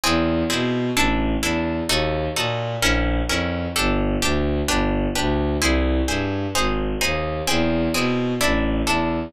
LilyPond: <<
  \new Staff \with { instrumentName = "Orchestral Harp" } { \time 6/8 \key bes \mixolydian \tempo 4. = 129 <bis e' gis'>4. <bis e' gis'>4. | <d' e' a'>4. <d' e' a'>4. | <ees' ges' a'>4. <ees' ges' a'>4. | <des' fes' bes'>4. <des' fes' bes'>4. |
<d' g' a'>4. <d' g' a'>4. | <d' g' b'>4. <d' g' b'>4. | <e' gis' c''>4. <e' gis' c''>4. | <ees' aes' c''>4. <ees' aes' c''>4. |
<bis e' gis'>4. <bis e' gis'>4. | <d' e' a'>4. <d' e' a'>4. | }
  \new Staff \with { instrumentName = "Violin" } { \clef bass \time 6/8 \key bes \mixolydian e,4. b,4. | a,,4. e,4. | ees,4. bes,4. | bes,,4. f,4. |
g,,4. d,4. | g,,4. d,4. | c,4. g,4. | aes,,4. ees,4. |
e,4. b,4. | a,,4. e,4. | }
>>